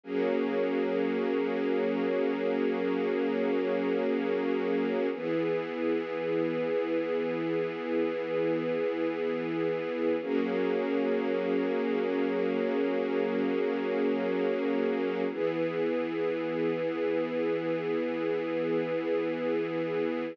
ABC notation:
X:1
M:5/4
L:1/8
Q:1/4=118
K:Elyd
V:1 name="String Ensemble 1"
[F,A,CG]10- | [F,A,CG]10 | [E,B,G]10- | [E,B,G]10 |
[F,A,CG]10- | [F,A,CG]10 | [E,B,G]10- | [E,B,G]10 |]